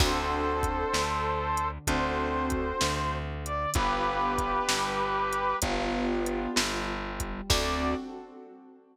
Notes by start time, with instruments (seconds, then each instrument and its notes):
0.00 electric bass (finger) D2, acoustic grand piano C4 D4 F#4 A4, brass section A4 C5, kick, crash
0.63 kick, closed hi-hat
0.94 electric bass (finger) D2, acoustic grand piano D3, snare
1.57 closed hi-hat
1.87 electric bass (finger) D2, acoustic grand piano C4 D4 F#4 A4, brass section C5, kick, closed hi-hat
2.50 kick, closed hi-hat
2.81 electric bass (finger) D2, acoustic grand piano D3, snare
3.45 brass section D5, closed hi-hat
3.74 electric bass (finger) G1, acoustic grand piano B3 D4 F4 G4, brass section G4 B4, kick, closed hi-hat
4.38 kick, closed hi-hat
4.69 electric bass (finger) G1, acoustic grand piano G3, snare
5.33 closed hi-hat
5.62 electric bass (finger) G1, acoustic grand piano B3 D4 F4 G4, kick, closed hi-hat
6.26 closed hi-hat
6.56 electric bass (finger) G1, acoustic grand piano G3, snare
7.20 kick, closed hi-hat
7.49 electric bass (finger) D2, acoustic grand piano C4 D4 F#4 A4, brass section D5, kick, crash